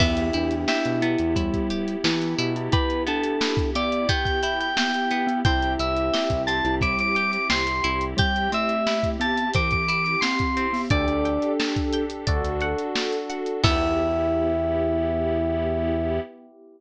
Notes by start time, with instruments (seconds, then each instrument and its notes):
0.00 synth bass 1 E2, pad 5 (bowed) B3 E4 G4, acoustic guitar (steel) B3, electric piano 1 B3 E4 G4, glockenspiel B3, electric piano 2 E4, kick, crash
0.17 closed hi-hat
0.33 synth bass 1 E2, glockenspiel D4, acoustic guitar (steel) E4, closed hi-hat
0.51 closed hi-hat
0.68 electric piano 2 E4, acoustic guitar (steel) G4, snare
0.85 synth bass 1 B2, closed hi-hat
1.02 acoustic guitar (steel) B3, glockenspiel E4, closed hi-hat
1.18 synth bass 1 E2, closed hi-hat
1.36 glockenspiel G3, acoustic guitar (steel) E4, kick, closed hi-hat
1.54 kick, closed hi-hat
1.70 acoustic guitar (steel) G4, closed hi-hat
1.88 closed hi-hat
2.04 synth bass 1 E3, acoustic guitar (steel) B3, glockenspiel E4, snare
2.22 closed hi-hat
2.38 synth bass 1 B2, acoustic guitar (steel) E4, closed hi-hat
2.56 glockenspiel E4, closed hi-hat
2.72 glockenspiel E4, acoustic guitar (steel) G4, electric piano 2 B4, kick, closed hi-hat
2.90 closed hi-hat
3.07 acoustic guitar (steel) B3, glockenspiel D4, electric piano 2 A4, closed hi-hat
3.24 closed hi-hat
3.41 acoustic guitar (steel) E4, snare
3.57 kick, closed hi-hat
3.75 glockenspiel B3, acoustic guitar (steel) G4, electric piano 2 D5, closed hi-hat
3.92 closed hi-hat
4.09 acoustic guitar (steel) B3, glockenspiel G4, electric piano 2 G5, kick, closed hi-hat
4.25 electric piano 2 G5, kick, closed hi-hat
4.43 acoustic guitar (steel) E4, electric piano 2 G5, closed hi-hat
4.60 electric piano 2 G5, closed hi-hat
4.77 glockenspiel B3, acoustic guitar (steel) G4, electric piano 2 G5, snare
4.94 closed hi-hat
5.11 acoustic guitar (steel) B3, closed hi-hat
5.27 glockenspiel B3, closed hi-hat
5.44 synth bass 1 C2, pad 5 (bowed) C4 E4 G4, acoustic guitar (steel) C4, electric piano 1 C4 E4 G4, glockenspiel E4, electric piano 2 G5, kick, closed hi-hat
5.62 closed hi-hat
5.79 synth bass 1 C2, acoustic guitar (steel) E4, electric piano 2 E5, closed hi-hat
5.97 closed hi-hat
6.13 acoustic guitar (steel) G4, snare
6.30 synth bass 1 C2, kick, closed hi-hat
6.47 acoustic guitar (steel) C4, electric piano 2 A5, closed hi-hat
6.65 synth bass 1 C2, glockenspiel E4, closed hi-hat
6.81 glockenspiel G3, acoustic guitar (steel) E4, electric piano 2 D6, kick, closed hi-hat
6.99 electric piano 2 D6, closed hi-hat
7.15 acoustic guitar (steel) G4, electric piano 2 D6, closed hi-hat
7.32 electric piano 2 D6, closed hi-hat
7.50 synth bass 1 C2, acoustic guitar (steel) C4, electric piano 2 C6, snare
7.67 closed hi-hat
7.84 synth bass 1 C2, acoustic guitar (steel) E4, closed hi-hat
8.01 closed hi-hat
8.17 glockenspiel G3, acoustic guitar (steel) G4, electric piano 2 G5, kick, closed hi-hat
8.36 closed hi-hat
8.52 glockenspiel A3, acoustic guitar (steel) C4, electric piano 2 E5, closed hi-hat
8.69 closed hi-hat
8.87 acoustic guitar (steel) E4, snare
9.03 kick, closed hi-hat
9.20 glockenspiel B3, acoustic guitar (steel) G4, electric piano 2 A5, closed hi-hat
9.37 closed hi-hat
9.54 glockenspiel E3, acoustic guitar (steel) C4, electric piano 2 D6, kick, closed hi-hat
9.71 electric piano 2 D6, kick, closed hi-hat
9.88 acoustic guitar (steel) E4, electric piano 2 D6, closed hi-hat
10.04 electric piano 2 D6, closed hi-hat
10.21 glockenspiel C4, acoustic guitar (steel) G4, electric piano 2 C6, snare
10.39 kick, closed hi-hat
10.57 acoustic guitar (steel) C4, closed hi-hat
10.73 glockenspiel B3, open hi-hat
10.90 synth bass 1 D2, pad 5 (bowed) D4 G4 A4, glockenspiel D4, electric piano 1 D4 G4 A4, acoustic guitar (steel) D5, electric piano 2 D5, kick, closed hi-hat
11.08 synth bass 1 D2, closed hi-hat
11.25 acoustic guitar (steel) G5, closed hi-hat
11.42 closed hi-hat
11.60 acoustic guitar (steel) A5, snare
11.76 kick, closed hi-hat
11.93 acoustic guitar (steel) G5, closed hi-hat
12.10 closed hi-hat
12.27 synth bass 1 D2, pad 5 (bowed) D4 F#4 A4, electric piano 1 D4 F#4 A4, acoustic guitar (steel) D5, kick, closed hi-hat
12.44 synth bass 1 D2, closed hi-hat
12.61 acoustic guitar (steel) F#5, closed hi-hat
12.79 closed hi-hat
12.95 acoustic guitar (steel) A5, snare
13.12 closed hi-hat
13.30 acoustic guitar (steel) F#5, closed hi-hat
13.46 closed hi-hat
13.63 synth bass 1 E2, electric piano 1 B3 E4 G4, acoustic guitar (steel) B3 E4 G4, pad 5 (bowed) B3 E4 G4, glockenspiel E4, electric piano 2 E5, kick, crash